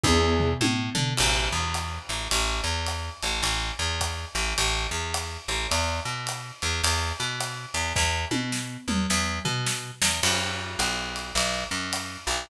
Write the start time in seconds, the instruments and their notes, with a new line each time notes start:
0.03 electric bass (finger) E2, acoustic grand piano B3 D4 E4 G#4, kick, high tom
0.40 floor tom
0.61 electric bass (finger) A2, high tom
0.95 electric bass (finger) D3, floor tom
1.17 electric bass (finger) A1, crash, ride
1.52 electric bass (finger) E2
1.74 hi-hat pedal, ride
2.09 electric bass (finger) A1, ride
2.31 electric bass (finger) A1, ride
2.64 electric bass (finger) E2
2.86 hi-hat pedal, ride
3.23 electric bass (finger) A1, ride
3.42 electric bass (finger) A1, ride
3.79 electric bass (finger) E2
4.01 kick, hi-hat pedal, ride
4.35 electric bass (finger) A1, ride
4.58 electric bass (finger) A1, ride
4.91 electric bass (finger) E2
5.14 hi-hat pedal, ride
5.48 electric bass (finger) A1, ride
5.71 electric bass (finger) E2, ride
6.05 electric bass (finger) B2
6.27 hi-hat pedal, ride
6.62 electric bass (finger) E2, ride
6.83 electric bass (finger) E2, ride
7.20 electric bass (finger) B2
7.40 hi-hat pedal, ride
7.74 electric bass (finger) E2, ride
7.96 electric bass (finger) E2, kick, snare
8.31 electric bass (finger) B2, high tom
8.52 snare
8.88 electric bass (finger) E2, mid tom
9.10 electric bass (finger) E2, snare
9.45 electric bass (finger) B2, floor tom
9.66 snare
10.02 electric bass (finger) E2, snare
10.23 electric bass (finger) F#2, crash, ride
10.79 electric bass (finger) B1, hi-hat pedal, ride
11.16 ride
11.35 electric bass (finger) B1, ride
11.71 electric bass (finger) F#2
11.93 hi-hat pedal, ride
12.27 electric bass (finger) B1, ride